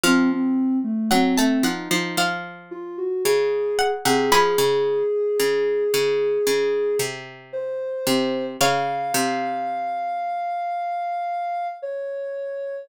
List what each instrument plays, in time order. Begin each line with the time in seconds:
0.04 harpsichord F3, ocarina C4, pizzicato strings F5
0.30 ocarina C4
0.84 ocarina A3
1.11 harpsichord F#3, ocarina C4, pizzicato strings F#5
1.38 harpsichord A3, ocarina C4, pizzicato strings A5
1.63 harpsichord F3, ocarina D#4, pizzicato strings F#5
1.91 harpsichord F3, ocarina D#4
2.17 harpsichord F3, pizzicato strings F5
2.71 ocarina F4
2.98 ocarina F#4
3.25 harpsichord C#3, ocarina G#4
3.79 pizzicato strings F#5
4.05 harpsichord C3, ocarina G#4, pizzicato strings F#5
4.31 harpsichord F3, ocarina G#4, pizzicato strings G#5 B5
4.58 harpsichord C#3
5.40 harpsichord C#3
5.94 harpsichord C#3
6.47 harpsichord C#3
6.99 harpsichord C3
7.53 ocarina C5
8.07 harpsichord C3
8.61 harpsichord C#3, pizzicato strings C#5 F5, ocarina F5
9.14 harpsichord C3
11.82 ocarina C#5